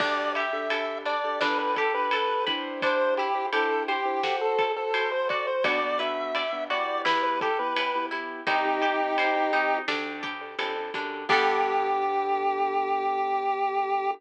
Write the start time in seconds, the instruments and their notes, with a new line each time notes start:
0.00 electric bass (finger) D2, acoustic grand piano D4 G4 A4, acoustic guitar (steel) D4, lead 1 (square) D5, kick, crash
0.35 acoustic guitar (steel) G4, lead 1 (square) E5, ride
0.53 acoustic grand piano D4 G4 A4
0.70 acoustic grand piano D4 G4 A4, acoustic guitar (steel) A4, ride
1.05 acoustic guitar (steel) D4, lead 1 (square) D5, ride
1.24 acoustic grand piano D4 G4 A4
1.41 electric bass (finger) G1, acoustic guitar (steel) D4, acoustic grand piano D4 G4 A4 B4, lead 1 (square) B4, snare
1.59 lead 1 (square) B4
1.76 acoustic guitar (steel) G4, lead 1 (square) A4, kick, ride
1.94 acoustic grand piano D4 G4 A4 B4, lead 1 (square) B4
2.11 acoustic grand piano D4 G4 A4 B4, acoustic guitar (steel) A4, ride
2.47 acoustic grand piano D4 E4 G4 C5, acoustic guitar (steel) B4, kick, ride
2.82 acoustic guitar (steel) D4, lead 1 (square) C5, kick, ride
3.17 acoustic guitar (steel) E4, lead 1 (square) G4, ride
3.35 acoustic grand piano D4 E4 G4 C5
3.53 acoustic grand piano D4 E4 G4 C5, acoustic guitar (steel) G4, lead 1 (square) A4, ride
3.88 lead 1 (square) G4, acoustic guitar (steel) C5, ride
4.05 acoustic grand piano D4 E4 G4 C5
4.23 acoustic guitar (steel) F#4, acoustic grand piano F#4 A4 C5, snare
4.41 lead 1 (square) A4
4.59 acoustic guitar (steel) A4, kick, ride
4.76 acoustic grand piano F#4 A4 C5, lead 1 (square) A4
4.94 acoustic grand piano F#4 A4 C5, acoustic guitar (steel) C5, ride
5.12 lead 1 (square) C5
5.29 acoustic guitar (steel) F#4, lead 1 (square) D5, kick, ride
5.47 lead 1 (square) C5
5.64 electric bass (finger) B1, acoustic grand piano B3 D4 F#4, acoustic guitar (steel) F#4, lead 1 (square) D5, kick, ride
5.83 acoustic grand piano B3 D4 F#4
5.99 acoustic grand piano B3 D4 F#4, acoustic guitar (steel) B4, lead 1 (square) E5, ride
6.35 acoustic guitar (steel) D5, ride
6.52 acoustic grand piano B3 D4 F#4
6.70 acoustic grand piano B3 E4 G4, acoustic guitar (steel) F#4, lead 1 (square) D5, ride
7.05 electric bass (finger) E2, acoustic guitar (steel) E4, lead 1 (square) B4, snare
7.23 lead 1 (square) B4
7.41 acoustic guitar (steel) G4, lead 1 (square) A4, kick, ride
7.59 acoustic grand piano B3 E4 G4, lead 1 (square) B4
7.76 acoustic grand piano B3 E4 G4, acoustic guitar (steel) B4, ride
7.95 acoustic grand piano B3 E4 G4
8.11 acoustic grand piano B3 E4 G4, acoustic guitar (steel) E4, ride
8.47 electric bass (finger) C2, acoustic grand piano C4 D#4 G4, acoustic guitar (steel) D#4, lead 1 (square) D#4 G4, kick, ride
8.65 acoustic grand piano C4 D#4 G4
8.82 acoustic grand piano C4 D#4 G4, acoustic guitar (steel) G4, ride
9.18 acoustic guitar (steel) C5, ride
9.36 acoustic grand piano C4 D#4 G4
9.53 acoustic grand piano C4 D#4 G4, acoustic guitar (steel) D#4, ride
9.88 electric bass (finger) D2, acoustic guitar (steel) D4, acoustic grand piano D4 G4 A4, snare
10.23 acoustic guitar (steel) G4, kick, ride
10.41 acoustic grand piano D4 G4 A4
10.59 electric bass (finger) F2, acoustic grand piano D4 G4 A4, acoustic guitar (steel) A4, ride
10.76 acoustic grand piano D4 G4 A4
10.94 electric bass (finger) F#2, acoustic grand piano D4 G4 A4, acoustic guitar (steel) D4, kick, ride
11.29 electric bass (finger) G2, acoustic grand piano B3 D4 G4 A4, acoustic guitar (steel) B3 D4 G4 A4, lead 1 (square) G4, kick, crash